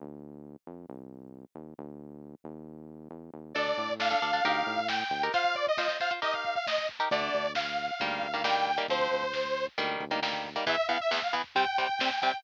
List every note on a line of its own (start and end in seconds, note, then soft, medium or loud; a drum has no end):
0.00 0.57 D2 medium
0.67 0.86 F2 medium
0.89 1.45 C2 medium
1.55 1.74 D#2 medium
1.78 2.35 D2 medium
2.44 3.08 D#2 medium
3.10 3.30 E2 medium
3.34 3.54 D#2 medium
3.55 3.74 D2 medium
3.55 3.91 D4 loud
3.55 3.91 A4 loud
3.55 3.93 D5 medium
3.55 kick medium
3.55 crash medium
3.68 kick medium
3.77 4.15 A2 medium
3.77 kick medium
3.77 closed hi-hat medium
3.89 kick medium
4.00 4.09 D4 medium
4.00 4.09 A4 medium
4.00 4.87 F5 loud
4.00 kick medium
4.00 snare medium
4.10 4.19 D4 medium
4.10 4.19 A4 loud
4.10 kick medium
4.22 4.41 D2 medium
4.22 4.31 D4 loud
4.22 4.31 A4 medium
4.22 kick medium
4.22 closed hi-hat medium
4.33 4.42 D4 medium
4.33 4.42 A4 medium
4.33 kick medium
4.45 4.63 D2 medium
4.45 4.80 D#4 loud
4.45 4.80 G4 loud
4.45 4.80 A#4 loud
4.45 kick medium
4.45 closed hi-hat medium
4.56 kick medium
4.66 5.04 A2 medium
4.66 kick medium
4.66 closed hi-hat medium
4.78 kick medium
4.88 5.25 G5 medium
4.88 kick medium
4.88 snare medium
5.00 kick medium
5.11 5.30 D2 medium
5.11 kick medium
5.11 closed hi-hat medium
5.22 5.32 D#4 medium
5.22 5.32 G4 medium
5.22 5.32 A#4 loud
5.22 kick medium
5.32 5.69 F4 loud
5.32 5.69 C5 loud
5.32 5.55 F5 loud
5.32 kick medium
5.32 closed hi-hat medium
5.44 kick medium
5.55 5.66 D5 medium
5.55 kick medium
5.55 closed hi-hat soft
5.67 5.77 D#5 medium
5.67 kick medium
5.77 5.87 F4 medium
5.77 5.87 C5 loud
5.77 5.97 D#5 medium
5.77 kick medium
5.77 snare medium
5.88 5.98 F4 medium
5.88 5.98 C5 medium
5.88 kick medium
6.00 6.09 F4 medium
6.00 6.09 C5 loud
6.00 6.12 F5 medium
6.00 kick medium
6.00 closed hi-hat medium
6.11 6.20 F4 medium
6.11 6.20 C5 medium
6.11 kick medium
6.22 6.57 D#4 medium
6.22 6.57 G4 medium
6.22 6.57 A#4 loud
6.22 6.34 D#5 loud
6.22 kick medium
6.22 closed hi-hat medium
6.34 6.54 F5 medium
6.34 kick medium
6.45 kick medium
6.45 closed hi-hat medium
6.55 6.66 F5 medium
6.55 kick medium
6.67 6.87 D#5 medium
6.67 kick medium
6.67 snare medium
6.78 kick medium
6.89 kick medium
6.89 closed hi-hat soft
6.99 7.09 D#4 medium
6.99 7.09 G4 medium
6.99 7.09 A#4 medium
6.99 kick medium
7.11 7.30 D2 medium
7.11 7.47 D3 loud
7.11 7.47 A3 loud
7.11 7.52 D5 medium
7.11 kick medium
7.11 closed hi-hat medium
7.22 kick medium
7.34 7.91 D2 medium
7.34 kick medium
7.34 closed hi-hat medium
7.45 kick medium
7.55 8.43 F5 medium
7.55 kick medium
7.55 snare medium
7.66 kick medium
7.78 kick medium
7.78 closed hi-hat medium
7.88 kick medium
7.99 8.20 D2 medium
7.99 8.27 D#3 medium
7.99 8.27 G3 loud
7.99 8.27 A#3 loud
7.99 kick medium
7.99 closed hi-hat medium
8.10 kick medium
8.21 8.79 D2 medium
8.21 kick medium
8.21 closed hi-hat medium
8.33 8.42 D#3 medium
8.33 8.42 G3 medium
8.33 8.42 A#3 medium
8.33 kick medium
8.44 8.71 D#3 medium
8.44 8.71 G3 medium
8.44 8.71 A#3 loud
8.44 8.82 G5 medium
8.44 kick medium
8.44 snare medium
8.56 kick medium
8.67 kick medium
8.67 closed hi-hat medium
8.77 8.86 D#3 medium
8.77 8.86 G3 medium
8.77 8.86 A#3 medium
8.77 kick medium
8.88 9.08 D2 medium
8.88 9.25 F3 loud
8.88 9.25 C4 medium
8.88 9.66 C5 medium
8.88 kick medium
8.88 closed hi-hat medium
9.00 kick medium
9.11 9.68 D2 medium
9.11 kick medium
9.11 closed hi-hat medium
9.23 kick medium
9.33 kick medium
9.33 snare medium
9.45 kick medium
9.55 kick medium
9.55 closed hi-hat medium
9.67 kick medium
9.78 9.97 D2 medium
9.78 10.04 D#3 loud
9.78 10.04 G3 loud
9.78 10.04 A#3 loud
9.78 kick medium
9.78 closed hi-hat medium
9.89 kick medium
10.00 10.57 D2 medium
10.00 kick medium
10.00 closed hi-hat medium
10.11 10.20 D#3 medium
10.11 10.20 G3 medium
10.11 10.20 A#3 medium
10.11 kick medium
10.22 10.49 D#3 medium
10.22 10.49 G3 medium
10.22 10.49 A#3 medium
10.22 kick medium
10.22 snare medium
10.33 kick medium
10.45 kick medium
10.45 closed hi-hat medium
10.56 10.65 D#3 medium
10.56 10.65 G3 medium
10.56 10.65 A#3 medium
10.56 kick medium
10.66 10.75 E2 loud
10.66 10.75 E3 loud
10.66 10.75 B3 loud
10.66 10.87 E5 medium
10.66 kick medium
10.66 floor tom medium
10.77 kick medium
10.88 10.98 E2 medium
10.88 10.98 E3 medium
10.88 10.98 B3 loud
10.88 10.99 F5 medium
10.88 kick medium
10.88 floor tom medium
11.00 11.11 E5 medium
11.00 kick medium
11.11 11.20 E2 medium
11.11 11.20 E3 medium
11.11 11.20 B3 medium
11.11 11.22 E5 medium
11.11 kick medium
11.11 snare medium
11.22 11.34 F5 medium
11.22 kick medium
11.33 11.42 E2 medium
11.33 11.42 E3 medium
11.33 11.42 B3 medium
11.33 kick medium
11.33 floor tom medium
11.44 kick medium
11.55 11.65 C3 medium
11.55 11.65 G3 loud
11.55 11.65 C4 loud
11.55 12.20 G5 medium
11.55 kick medium
11.55 floor tom medium
11.66 kick medium
11.78 11.87 C3 medium
11.78 11.87 G3 medium
11.78 11.87 C4 medium
11.78 kick medium
11.78 floor tom medium
11.89 kick medium
11.99 12.10 C3 medium
11.99 12.10 G3 medium
11.99 12.10 C4 loud
11.99 kick medium
11.99 snare medium
12.11 kick medium
12.21 12.32 C3 medium
12.21 12.32 G3 medium
12.21 12.32 C4 medium
12.21 12.41 G5 medium
12.21 kick medium
12.21 floor tom medium
12.34 kick medium